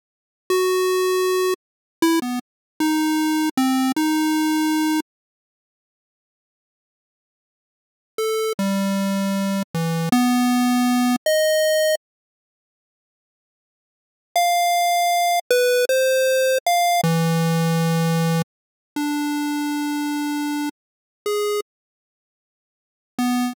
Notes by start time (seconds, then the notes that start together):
0.50 F#4
2.02 E4
2.22 B3
2.80 D#4
3.57 C4
3.96 D#4
8.18 A4
8.59 G3
9.75 E3
10.12 B3
11.26 D#5
14.36 F5
15.50 B4
15.89 C5
16.67 F5
17.04 E3
18.96 D4
21.26 G#4
23.19 B3